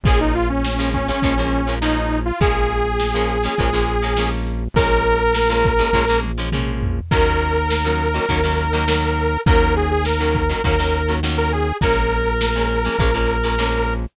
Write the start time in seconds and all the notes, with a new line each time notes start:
0.03 A#1 F3 G#3 A#3 C#4 G#4, kick, closed hi-hat
0.20 D#4
0.34 F4, closed hi-hat
0.49 C#4
0.64 snare
0.79 F3 G#3 A#3 C#4
0.93 C#4, kick, closed hi-hat
1.08 F3 G#3 A#3 C#4
1.22 A#1 F3 G#3 A#3 C#4, kick, closed hi-hat
1.38 F3 G#3 A#3 C#4
1.53 closed hi-hat
1.67 F3 G#3 A#3 C#4
1.81 F3 G#3 A#3 C#4 D#4, snare
2.11 closed hi-hat
2.25 F4
2.40 A#1 F3 G#3 A#3 C#4 G#4, kick, closed hi-hat
2.70 closed hi-hat
3.00 snare
3.14 F3 G#3 A#3 C#4
3.29 closed hi-hat
3.44 F3 G#3 A#3 C#4
3.58 A#1 F3 G#3 A#3 C#4, kick, closed hi-hat
3.73 F3 G#3 A#3 C#4
3.88 closed hi-hat
4.02 F3 G#3 A#3 C#4
4.17 F3 G#3 A#3 C#4, snare
4.47 closed hi-hat
4.74 A#1 F3 G#3 A#3 C#4 A#4, kick, closed hi-hat
5.06 closed hi-hat
5.34 snare
5.49 F3 G#3 A#3 C#4
5.64 kick, closed hi-hat
5.79 F3 G#3 A#3 C#4
5.93 A#1 F3 G#3 A#3 C#4, kick, snare
6.08 F3 G#3 A#3 C#4
6.23 high tom
6.38 F3 G#3 A#3 C#4
6.52 F3 G#3 A#3 C#4, mid tom
6.83 floor tom
7.11 D#2 D#3 F#3 A#3 C#4 A#4, kick, crash
7.41 closed hi-hat
7.70 snare
7.85 D#3 F#3 A#3 C#4
8.00 closed hi-hat
8.14 D#3 F#3 A#3 C#4
8.28 D#2 D#3 F#3 A#3 C#4, kick, closed hi-hat
8.44 D#3 F#3 A#3 C#4
8.58 closed hi-hat
8.73 D#3 F#3 A#3 C#4
8.88 D#3 F#3 A#3 C#4, snare
9.17 closed hi-hat
9.46 D#2 D#3 F#3 A#3 C#4 A#4, kick, closed hi-hat
9.76 G#4, closed hi-hat
9.91 G#4
10.05 A#4, snare
10.20 D#3 F#3 A#3 C#4
10.34 kick, closed hi-hat
10.49 D#3 F#3 A#3 C#4
10.64 D#2 D#3 F#3 A#3 C#4 A#4, kick, closed hi-hat
10.79 D#3 F#3 A#3 C#4
10.93 closed hi-hat
11.08 D#3 F#3 A#3 C#4
11.23 D#3 F#3 A#3 C#4, snare
11.38 A#4
11.52 G#4, closed hi-hat
11.81 A#1 F3 G#3 A#3 C#4 A#4, kick, closed hi-hat
12.12 closed hi-hat
12.41 snare
12.55 F3 G#3 A#3 C#4
12.69 closed hi-hat
12.85 F3 G#3 A#3 C#4
12.99 A#1 F3 G#3 A#3 C#4, kick, closed hi-hat
13.14 F3 G#3 A#3 C#4
13.29 closed hi-hat
13.44 F3 G#3 A#3 C#4
13.58 F3 G#3 A#3 C#4, snare
13.88 closed hi-hat